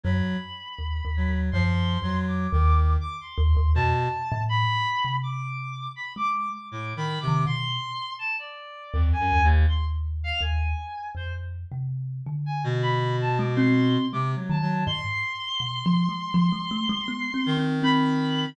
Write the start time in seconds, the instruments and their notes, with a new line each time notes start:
0.03 kalimba F#2, clarinet F#3 B5
0.79 kalimba D#2
1.05 kalimba D#2
1.16 clarinet F#3
1.29 kalimba D#2
1.52 kalimba F#2, clarinet F3 C6
2.02 kalimba F2, clarinet F#3
2.27 clarinet D6
2.52 kalimba D#2, clarinet D#3
3.01 clarinet D6
3.21 clarinet C6
3.38 kalimba D#2
3.57 kalimba D#2
3.75 kalimba F2, clarinet B2 A5
4.32 kalimba A2
4.49 clarinet B5
5.04 kalimba C3
5.23 clarinet D6
5.96 clarinet B5
6.16 kalimba G#3, clarinet D6
6.52 clarinet D6
6.71 clarinet A2 D6
6.96 clarinet D#3 B5
7.20 clarinet C3 D6
7.28 kalimba D#3
7.46 kalimba B2, clarinet C6
8.19 clarinet A5
8.39 clarinet D5
8.93 kalimba D#2, clarinet F2
9.13 clarinet G#5
9.19 clarinet F#2
9.32 kalimba D#2
9.43 clarinet D#2
9.68 clarinet C6
10.24 clarinet F5
10.41 kalimba D#2, clarinet G#5
11.15 kalimba F2, clarinet C5
11.71 kalimba C3
12.26 kalimba D3
12.46 clarinet G#5
12.64 clarinet B2
12.82 clarinet B5
13.21 clarinet A5
13.38 kalimba G#3, clarinet D6
13.55 kalimba C4, clarinet C6
14.12 clarinet C3 D6, kalimba G#3
14.35 clarinet F#3
14.49 kalimba D#3, clarinet A5
14.62 clarinet F#3
14.86 kalimba G#2, clarinet C6
15.60 kalimba B2
15.86 kalimba F3
16.09 kalimba G#3
16.34 kalimba F3
16.52 kalimba G#3
16.71 kalimba A3
16.89 kalimba G#3
17.08 kalimba B3
17.34 kalimba C4
17.46 clarinet D#3
17.57 kalimba C4
17.83 kalimba C4, clarinet B5